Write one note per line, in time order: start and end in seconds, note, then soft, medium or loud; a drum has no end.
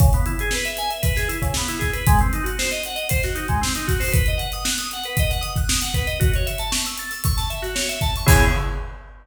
0.00 0.10 C#3 medium
0.00 kick loud
0.00 closed hi-hat medium
0.13 0.26 B3 medium
0.13 closed hi-hat medium
0.26 0.37 E4 medium
0.26 closed hi-hat medium
0.39 0.52 G#4 medium
0.39 closed hi-hat medium
0.51 0.64 B4 medium
0.51 snare medium
0.65 0.77 E5 medium
0.65 closed hi-hat medium
0.77 0.90 G#5 medium
0.77 closed hi-hat medium
0.90 1.02 E5 medium
0.90 closed hi-hat medium
1.02 1.14 B4 medium
1.02 kick medium
1.02 closed hi-hat medium
1.16 1.28 G#4 medium
1.16 snare soft
1.16 closed hi-hat medium
1.28 1.40 E4 medium
1.28 closed hi-hat medium
1.42 1.53 C#3 medium
1.42 kick medium
1.42 closed hi-hat medium
1.54 1.69 B3 medium
1.54 snare medium
1.67 1.80 E4 medium
1.67 snare soft
1.67 closed hi-hat medium
1.79 1.91 G#4 medium
1.79 kick medium
1.79 snare soft
1.79 closed hi-hat medium
1.93 2.05 B4 medium
1.93 closed hi-hat medium
2.07 2.19 G#3 loud
2.07 kick loud
2.07 closed hi-hat loud
2.19 2.32 C4 medium
2.19 closed hi-hat medium
2.33 2.45 D#4 medium
2.33 closed hi-hat medium
2.44 2.55 F#4 medium
2.44 closed hi-hat medium
2.59 2.70 C5 medium
2.59 snare medium
2.71 2.83 D#5 medium
2.71 snare soft
2.71 closed hi-hat medium
2.84 2.98 F#5 medium
2.84 closed hi-hat medium
2.95 3.07 D#5 medium
2.95 closed hi-hat medium
3.09 3.22 C5 medium
3.09 kick medium
3.09 closed hi-hat loud
3.23 3.35 F#4 medium
3.23 snare medium
3.23 closed hi-hat medium
3.35 3.47 D#4 medium
3.35 closed hi-hat medium
3.48 3.60 G#3 medium
3.48 kick medium
3.48 closed hi-hat medium
3.61 3.73 C4 medium
3.61 snare medium
3.75 3.87 D#4 medium
3.75 closed hi-hat medium
3.87 3.99 F#4 medium
3.87 kick medium
3.87 closed hi-hat medium
4.00 4.12 C5 medium
4.00 snare soft
4.00 open hi-hat medium
4.12 4.24 B4 medium
4.12 kick medium
4.12 closed hi-hat loud
4.26 4.39 D#5 medium
4.26 closed hi-hat medium
4.38 4.49 F#5 medium
4.38 closed hi-hat medium
4.52 4.65 D#6 medium
4.52 closed hi-hat medium
4.65 4.76 F#6 medium
4.65 snare loud
4.78 4.90 D#6 medium
4.78 closed hi-hat medium
4.91 5.05 F#5 medium
4.91 closed hi-hat medium
5.04 5.17 B4 medium
5.04 closed hi-hat medium
5.17 5.31 D#5 medium
5.17 kick medium
5.17 closed hi-hat medium
5.30 5.42 F#5 medium
5.30 snare soft
5.30 closed hi-hat medium
5.41 5.53 D#6 medium
5.41 closed hi-hat medium
5.56 5.69 F#6 medium
5.56 kick medium
5.56 closed hi-hat medium
5.68 5.80 D#6 medium
5.68 snare loud
5.82 5.94 F#5 medium
5.82 closed hi-hat medium
5.94 6.06 B4 medium
5.94 kick medium
5.94 closed hi-hat medium
6.07 6.19 D#5 medium
6.07 closed hi-hat medium
6.20 6.31 F#4 medium
6.20 kick medium
6.20 closed hi-hat medium
6.34 6.47 C#5 medium
6.34 closed hi-hat medium
6.46 6.58 E5 medium
6.46 closed hi-hat medium
6.58 6.71 A5 medium
6.58 closed hi-hat medium
6.72 6.83 C#6 medium
6.72 snare loud
6.86 6.98 E6 medium
6.86 closed hi-hat medium
6.98 7.10 A6 medium
6.98 closed hi-hat medium
7.11 7.23 E6 medium
7.11 snare soft
7.11 closed hi-hat medium
7.24 7.36 C#6 medium
7.24 kick medium
7.24 closed hi-hat loud
7.37 7.49 A5 medium
7.37 snare soft
7.37 closed hi-hat medium
7.50 7.62 E5 medium
7.50 closed hi-hat medium
7.62 7.74 F#4 medium
7.62 snare soft
7.62 closed hi-hat medium
7.75 7.87 C#5 medium
7.75 snare medium
7.89 8.00 E5 medium
7.89 closed hi-hat medium
8.01 8.13 A5 medium
8.01 kick medium
8.01 closed hi-hat medium
8.16 8.28 C#6 medium
8.16 closed hi-hat medium
8.26 8.44 C#3 loud
8.26 8.44 B3 loud
8.26 8.44 E4 loud
8.26 8.44 G#4 loud
8.26 kick loud
8.26 crash loud